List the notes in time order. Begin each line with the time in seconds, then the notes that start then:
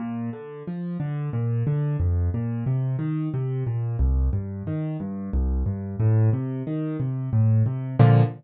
0.00 A#2
0.33 D3
0.68 F3
1.00 D3
1.33 A#2
1.67 D3
2.00 F2
2.34 A#2
2.66 C3
2.99 D#3
3.34 C3
3.67 A#2
3.99 C2
4.33 G2
4.67 D#3
5.00 G2
5.33 C2
5.66 G2
6.00 A2
6.33 C3
6.67 D#3
7.00 C3
7.33 A2
7.66 C3
7.99 A#2 D3 F3